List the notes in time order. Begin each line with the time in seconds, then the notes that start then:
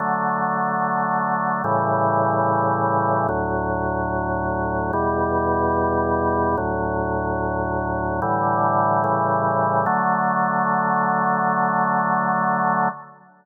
0.00 D3 F#3 A3
1.64 A2 C#3 E3 G3
3.29 D2 A2 F#3
4.93 E2 B2 G3
6.58 D2 A2 F#3
8.22 A2 D3 E3 G3
9.04 A2 C#3 E3 G3
9.86 D3 F#3 A3